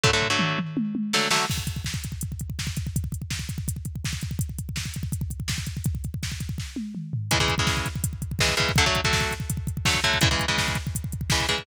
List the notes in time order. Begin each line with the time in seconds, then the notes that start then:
0.03 D3 F#3 A3, kick, floor tom
0.13 D3 F#3 A3
0.22 floor tom
0.30 D3 F#3 A3
0.39 mid tom
0.58 mid tom
0.77 high tom
0.95 high tom
1.13 D3 F#3 A3, snare
1.31 D3 F#3 A3, snare
1.50 kick, crash
1.58 kick
1.67 kick, closed hi-hat
1.76 kick
1.84 kick, snare
1.94 kick
2.04 kick, closed hi-hat
2.12 kick
2.21 kick, closed hi-hat
2.32 kick
2.39 kick, closed hi-hat
2.50 kick
2.59 kick, snare
2.67 kick
2.77 kick, closed hi-hat
2.87 kick
2.96 kick, closed hi-hat
3.04 kick
3.12 kick, closed hi-hat
3.22 kick
3.30 kick, snare
3.39 kick
3.49 kick, closed hi-hat
3.58 kick
3.68 kick, closed hi-hat
3.76 kick
3.85 kick, closed hi-hat
3.96 kick
4.04 kick, snare
4.13 kick
4.21 kick, closed hi-hat
4.31 kick
4.39 kick, closed hi-hat
4.49 kick
4.58 kick, closed hi-hat
4.69 kick
4.76 kick, snare
4.86 kick
4.94 kick, closed hi-hat
5.03 kick
5.12 kick, closed hi-hat
5.21 kick
5.30 kick, closed hi-hat
5.40 kick
5.48 kick, snare
5.58 kick
5.66 kick, closed hi-hat
5.77 kick
5.84 kick, closed hi-hat
5.95 kick
6.04 kick, closed hi-hat
6.14 kick
6.23 kick, snare
6.32 kick
6.40 kick, closed hi-hat
6.49 kick
6.58 kick, snare
6.76 high tom
6.95 mid tom
7.13 floor tom
7.31 C#3 E3 G#3, kick, closed hi-hat
7.40 C#3 E3 G#3, kick
7.48 kick, closed hi-hat
7.58 C#3 E3 G#3, kick
7.67 kick, snare
7.77 kick
7.86 kick, closed hi-hat
7.96 kick
8.04 kick, closed hi-hat
8.13 kick
8.22 kick, closed hi-hat
8.31 kick
8.39 C#3 E3 G#3, kick, snare
8.49 kick
8.57 C#3 E3 G#3, kick, closed hi-hat
8.69 kick
8.76 D3 F#3 A3, kick, closed hi-hat
8.86 D3 F#3 A3, kick
8.95 kick, closed hi-hat
9.04 D3 F#3 A3, kick
9.13 kick, snare
9.21 kick
9.31 kick, closed hi-hat
9.40 kick
9.50 kick, closed hi-hat
9.57 kick
9.67 kick, closed hi-hat
9.77 kick
9.85 D3 F#3 A3, kick, snare
9.94 kick
10.04 D3 F#3 A3, kick, closed hi-hat
10.14 kick
10.21 C#3 E3 G#3, kick, closed hi-hat
10.31 C#3 E3 G#3, kick
10.39 kick, closed hi-hat
10.48 C#3 E3 G#3, kick
10.58 kick, snare
10.68 kick
10.75 kick, closed hi-hat
10.87 kick
10.95 kick, closed hi-hat
11.04 kick
11.12 kick, closed hi-hat
11.21 kick
11.30 C#3 E3 G#3, kick, snare
11.40 kick
11.49 C#3 E3 G#3, kick, closed hi-hat
11.58 kick